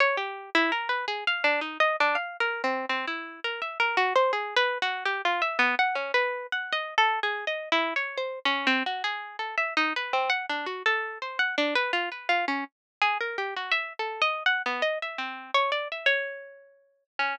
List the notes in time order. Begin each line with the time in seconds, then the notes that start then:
0.00 C#5
0.17 G4
0.55 E4
0.72 A#4
0.89 B4
1.08 G#4
1.27 F5
1.44 D4
1.61 D#4
1.80 D#5
2.00 D4
2.15 F5
2.40 A#4
2.64 C4
2.89 C4
3.08 E4
3.44 A#4
3.62 E5
3.80 A#4
3.97 F#4
4.16 C5
4.33 G#4
4.56 B4
4.82 F#4
5.05 G4
5.25 F4
5.42 E5
5.59 B3
5.79 F#5
5.95 C#4
6.14 B4
6.52 F#5
6.73 D#5
6.98 A4
7.23 G#4
7.47 D#5
7.72 E4
7.96 C#5
8.17 C5
8.45 C#4
8.67 C4
8.86 F#4
9.04 G#4
9.39 A4
9.58 E5
9.77 D#4
9.96 B4
10.13 C4
10.30 F#5
10.50 D4
10.66 F#4
10.86 A4
11.22 C5
11.39 F#5
11.58 D4
11.75 B4
11.93 F4
12.12 B4
12.29 F4
12.48 C#4
13.02 G#4
13.20 A#4
13.38 G4
13.56 F#4
13.72 E5
13.99 A4
14.22 D#5
14.46 F#5
14.66 B3
14.82 D#5
15.02 E5
15.18 C4
15.54 C#5
15.72 D5
15.92 E5
16.06 C#5
17.19 C#4